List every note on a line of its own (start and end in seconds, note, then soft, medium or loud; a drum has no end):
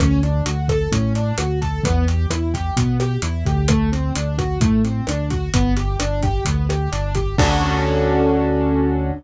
0.00 0.42 D2 loud
0.00 0.21 C#4 medium
0.00 kick medium
0.00 cross-stick loud
0.00 closed hi-hat medium
0.23 0.44 D4 medium
0.23 closed hi-hat medium
0.46 0.88 D2 medium
0.46 0.67 F#4 medium
0.46 closed hi-hat loud
0.68 0.90 A4 medium
0.68 kick medium
0.68 cross-stick medium
0.68 closed hi-hat medium
0.91 1.33 A2 medium
0.91 1.13 C#4 medium
0.91 kick medium
0.91 closed hi-hat loud
1.15 1.36 D4 medium
1.15 closed hi-hat medium
1.38 1.80 D2 medium
1.38 1.59 F#4 medium
1.38 cross-stick medium
1.38 closed hi-hat loud
1.62 1.82 A4 medium
1.62 kick medium
1.62 closed hi-hat medium
1.84 2.27 E2 loud
1.84 2.05 B3 loud
1.84 kick loud
1.84 closed hi-hat loud
2.08 2.28 G4 medium
2.08 closed hi-hat medium
2.30 2.72 E2 medium
2.30 2.52 E4 medium
2.30 cross-stick medium
2.30 closed hi-hat loud
2.54 2.75 G4 medium
2.54 kick medium
2.54 closed hi-hat medium
2.77 3.18 B2 medium
2.77 2.98 B3 medium
2.77 kick medium
2.77 closed hi-hat loud
3.00 3.21 G4 medium
3.00 cross-stick medium
3.00 closed hi-hat medium
3.22 3.44 E2 medium
3.22 3.44 E4 medium
3.22 closed hi-hat loud
3.46 4.12 D2 loud
3.46 3.67 G4 medium
3.46 kick medium
3.46 closed hi-hat medium
3.68 3.90 A3 loud
3.68 kick medium
3.68 cross-stick loud
3.68 closed hi-hat loud
3.92 4.13 C4 medium
3.92 closed hi-hat medium
4.15 4.58 D2 medium
4.15 4.36 D4 medium
4.15 closed hi-hat loud
4.38 4.59 F#4 medium
4.38 kick medium
4.38 cross-stick medium
4.38 closed hi-hat medium
4.60 5.02 A2 medium
4.60 4.82 A3 medium
4.60 kick loud
4.60 closed hi-hat loud
4.85 5.05 C4 medium
4.85 closed hi-hat medium
5.07 5.50 D2 medium
5.07 5.29 D4 medium
5.07 cross-stick medium
5.07 closed hi-hat loud
5.30 5.51 F#4 medium
5.30 kick medium
5.30 closed hi-hat medium
5.54 5.96 G1 loud
5.54 5.75 B3 loud
5.54 kick medium
5.54 closed hi-hat loud
5.77 5.98 G4 medium
5.77 closed hi-hat medium
6.00 6.41 G1 medium
6.00 6.21 D4 medium
6.00 cross-stick medium
6.00 closed hi-hat loud
6.23 6.44 G4 medium
6.23 kick medium
6.23 closed hi-hat medium
6.45 6.89 D2 loud
6.45 6.67 B3 medium
6.45 kick medium
6.45 closed hi-hat loud
6.69 6.90 G4 medium
6.69 cross-stick medium
6.69 closed hi-hat medium
6.92 7.35 G1 medium
6.92 7.13 D4 medium
6.92 closed hi-hat medium
7.15 7.36 G4 medium
7.15 kick medium
7.15 closed hi-hat medium
7.38 9.12 D2 loud
7.38 9.12 C#4 loud
7.38 9.12 D4 loud
7.38 9.12 F#4 loud
7.38 9.12 A4 medium
7.38 kick loud
7.38 crash loud